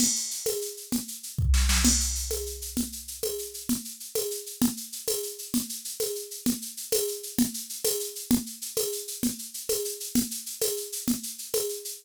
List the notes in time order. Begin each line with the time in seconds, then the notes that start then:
0.00 crash, low conga, shaker
0.15 shaker
0.31 shaker
0.46 tambourine, high conga, shaker
0.62 shaker
0.77 shaker
0.92 low conga, shaker
1.08 shaker
1.23 shaker
1.38 kick
1.54 snare
1.69 snare
1.85 crash, low conga, shaker
2.00 shaker
2.15 shaker
2.31 tambourine, high conga, shaker
2.46 shaker
2.62 shaker
2.77 low conga, shaker
2.92 shaker
3.08 shaker
3.23 tambourine, high conga
3.38 shaker
3.54 shaker
3.69 low conga, shaker
3.85 shaker
4.00 shaker
4.15 tambourine, high conga, shaker
4.31 shaker
4.46 shaker
4.62 low conga, shaker
4.77 shaker
4.92 shaker
5.08 tambourine, high conga, shaker
5.23 shaker
5.38 shaker
5.54 low conga, shaker
5.69 shaker
5.85 shaker
6.00 tambourine, high conga, shaker
6.15 shaker
6.31 shaker
6.46 low conga, shaker
6.62 shaker
6.77 shaker
6.92 tambourine, high conga, shaker
7.08 shaker
7.23 shaker
7.38 low conga, shaker
7.54 shaker
7.69 shaker
7.85 tambourine, high conga, shaker
8.00 shaker
8.15 shaker
8.31 low conga, shaker
8.46 shaker
8.61 shaker
8.77 tambourine, high conga, shaker
8.92 shaker
9.08 shaker
9.23 low conga, shaker
9.39 shaker
9.54 shaker
9.69 tambourine, high conga, shaker
9.85 shaker
10.00 shaker
10.15 low conga, shaker
10.31 shaker
10.46 shaker
10.62 tambourine, high conga, shaker
10.77 shaker
10.92 shaker
11.08 low conga, shaker
11.23 shaker
11.38 shaker
11.54 tambourine, high conga, shaker
11.69 shaker
11.85 shaker